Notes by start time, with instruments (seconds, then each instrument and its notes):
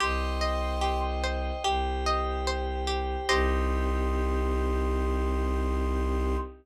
0.00 violin C2, pizzicato strings G4, pad 5 (bowed) C5 D#5 G5, flute C6
0.41 pizzicato strings D#5
0.81 pizzicato strings G4
1.24 pizzicato strings C5
1.64 violin C2, pizzicato strings G4, pad 5 (bowed) G4 C5 G5
2.06 pizzicato strings D#5
2.47 pizzicato strings C5
2.87 pizzicato strings G4
3.29 violin C2, pad 5 (bowed) C4 D#4 G4, pizzicato strings G4 C5 D#5, flute C6